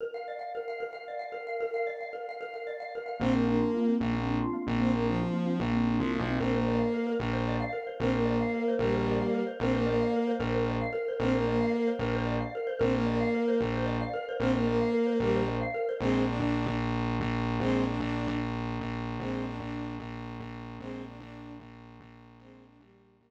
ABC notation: X:1
M:6/8
L:1/16
Q:3/8=150
K:Bbmix
V:1 name="Violin"
z12 | z12 | z12 | z12 |
C2 B,2 B,8 | z12 | C2 B,2 F,8 | z12 |
C2 B,2 B,8 | z12 | C2 B,2 B,8 | [G,B,]10 z2 |
C2 B,2 B,8 | z12 | C2 B,2 B,8 | z12 |
C2 B,2 B,8 | z12 | C2 B,2 B,8 | [G,B,]4 z8 |
[A,C]4 D2 D6 | z12 | [A,C]4 D2 D6 | z12 |
[A,C]4 D2 D6 | z12 | [A,C]4 D2 D6 | z12 |
[A,C]4 D2 G,6 | [G,B,]8 z4 |]
V:2 name="Xylophone"
B2 f2 d2 f2 B2 f2 | B2 f2 d2 f2 B2 f2 | B2 f2 d2 f2 B2 f2 | B2 f2 d2 f2 B2 f2 |
B,2 C2 D2 F2 B,2 C2 | B,2 C2 D2 F2 B,2 C2 | B,2 C2 D2 F2 B,2 C2 | B,2 C2 D2 F2 B,2 C2 |
B2 c2 d2 f2 B2 B2- | B2 c2 d2 f2 B2 c2 | B2 c2 d2 f2 B2 c2 | B2 c2 d2 f2 B2 c2 |
B2 c2 d2 f2 B2 c2 | B2 c2 d2 f2 B2 c2 | B2 c2 d2 f2 B2 c2 | B2 c2 d2 f2 B2 c2 |
B2 c2 d2 f2 B2 c2 | B2 c2 d2 f2 B2 c2 | B2 c2 d2 f2 B2 c2 | B2 c2 d2 f2 B2 c2 |
z12 | z12 | z12 | z12 |
z12 | z12 | z12 | z12 |
z12 | z12 |]
V:3 name="Synth Bass 1" clef=bass
z12 | z12 | z12 | z12 |
B,,,6 z6 | B,,,6 z4 B,,,2- | B,,,6 z6 | B,,,6 C,,3 =B,,,3 |
B,,,6 z6 | B,,,6 z6 | B,,,6 z6 | B,,,6 z6 |
B,,,6 z6 | B,,,6 z6 | B,,,6 z6 | B,,,6 z6 |
B,,,6 z6 | B,,,6 z6 | B,,,6 z6 | B,,,6 z6 |
B,,,6 B,,,4 B,,,2- | B,,,6 B,,,6 | B,,,6 B,,,4 B,,,2- | B,,,6 B,,,6 |
B,,,6 B,,,6 | B,,,6 B,,,6 | B,,,6 B,,,6 | B,,,6 B,,,6 |
B,,,6 B,,,6 | B,,,6 z6 |]